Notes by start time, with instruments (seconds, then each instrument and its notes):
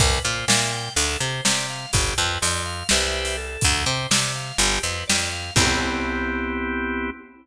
0.00 electric bass (finger) C2, drawbar organ B4, kick, closed hi-hat
0.24 electric bass (finger) A#2, drawbar organ C5
0.48 electric bass (finger) A#2, drawbar organ E5, snare
0.71 drawbar organ G5
0.96 electric bass (finger) D2, drawbar organ A4, closed hi-hat
1.20 electric bass (finger) C3, drawbar organ C5
1.45 electric bass (finger) C3, drawbar organ D5, snare
1.70 drawbar organ F5
1.93 electric bass (finger) G1, drawbar organ G4, kick, closed hi-hat
2.18 electric bass (finger) F2, drawbar organ B4
2.42 electric bass (finger) F2, drawbar organ D5, closed hi-hat
2.66 drawbar organ F5
2.89 electric bass (finger) C2, drawbar organ G4 B4 C5 E5, snare
3.25 closed hi-hat
3.37 drawbar organ A4
3.61 electric bass (finger) D2, kick, closed hi-hat
3.86 electric bass (finger) C3, drawbar organ C5
4.11 electric bass (finger) C3, drawbar organ D5, snare
4.36 drawbar organ F5
4.58 electric bass (finger) G1, drawbar organ G4, closed hi-hat
4.83 electric bass (finger) F2, drawbar organ B4
5.07 electric bass (finger) F2, drawbar organ D5, snare
5.32 drawbar organ F5
5.56 electric bass (finger) C2, drawbar organ B3 C4 E4 G4, kick, crash